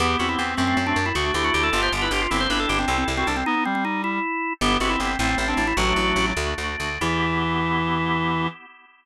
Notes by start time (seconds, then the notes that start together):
0.00 E2 B3 E4 G4
0.19 E2 C4 F#4
0.29 E4
0.38 E2 C4
0.57 F#2 A3 C4 F#4
0.67 C4
0.77 F#2 C4
0.87 C4 D4
0.96 F#2 D4
1.06 E4
1.15 D2 A3 D4 F#4
1.34 D2 E4 G4
1.44 F#4
1.54 D2 G4
1.63 A4
1.72 G1 B3 D4 F4 G4
1.83 C5
1.92 G1
2.02 E4 B4
2.11 G1 G4
2.21 F4
2.30 G1 C4 E4 G4
2.40 C5
2.49 G1 D4 B4
2.60 A4
2.69 G1 G4
2.79 C4
2.88 C2 C4 E4 A4
2.98 C4
3.08 C2
3.17 C4 F#4
3.27 C2 D4
3.37 C4
3.46 B3 D#4
3.55 B3
3.65 G3 C4
3.75 C4
3.85 D#4
4.04 E4
4.61 G1 B3 E4 G4
4.80 G1 C4 F#4
4.90 E4
5.00 G1 C4
5.19 A1 A3 C4 E4
5.29 C4
5.38 A1 C4
5.48 C4 D4
5.57 A1 D4
5.67 E4
5.77 A1 F#3 A3 D4 F#4
5.96 A1
6.16 A1
6.37 D2 A3 D4 F#4
6.58 D2
6.80 D2
7.01 E2 E3 B3 E4 G4